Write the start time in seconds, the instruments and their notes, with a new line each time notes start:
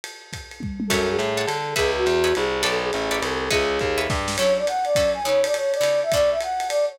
0.04 ride
0.33 kick, hi-hat pedal, ride
0.51 ride
0.60 kick, high tom
0.80 high tom
0.87 electric bass (finger) F#2, flute A4, acoustic guitar (steel) C#5 E5 F#5 A5, kick, crash, ride
1.10 flute G#4
1.19 electric bass (finger) A2, hi-hat pedal, ride
1.37 acoustic guitar (steel) C#5 E5 F#5 A5, ride
1.46 electric bass (finger) D3, flute A4, ride
1.76 electric bass (finger) C#2, flute G#4, acoustic guitar (steel) B4 C#5 D#5 E5, kick, ride
1.96 flute F#4
2.06 electric bass (finger) E2, hi-hat pedal, ride
2.24 acoustic guitar (steel) B4 C#5 D#5 E5, ride
2.35 electric bass (finger) C2, flute G#4, ride
2.63 electric bass (finger) B1, acoustic guitar (steel) A4 B4 C#5 D5, flute A4, ride
2.84 flute G#4
2.93 electric bass (finger) A1, hi-hat pedal, ride
3.11 acoustic guitar (steel) A4 B4 C#5 D5, ride
3.22 electric bass (finger) C2, flute A4, ride
3.50 electric bass (finger) C#2, flute G#4, acoustic guitar (steel) B4 C#5 D#5 E5, kick, ride
3.79 electric bass (finger) D#2, kick, hi-hat pedal, ride
3.98 acoustic guitar (steel) B4 C#5 D#5 E5, ride
4.10 electric bass (finger) G2, kick, snare
4.28 snare
4.36 acoustic guitar (steel) F#3 C#4 E4 A4, flute C#5, crash, ride
4.58 flute D5
4.67 flute F#5, hi-hat pedal, ride
4.84 flute D5, ride
4.95 acoustic guitar (steel) F#3 C#4 E4 A4, kick, ride
5.14 flute G#5
5.24 acoustic guitar (steel) C#3 B3 D#4 E4, flute C#5
5.44 flute D5, ride
5.54 flute C#5, hi-hat pedal, ride
5.74 flute D5, ride
5.81 acoustic guitar (steel) C#3 B3 D#4 E4, ride
6.03 flute E5
6.12 acoustic guitar (steel) B2 A3 C#4 D4, flute D5, kick, ride
6.31 flute E5
6.41 flute F#5, hi-hat pedal, ride
6.60 ride
6.69 flute D5, ride
6.89 flute C#5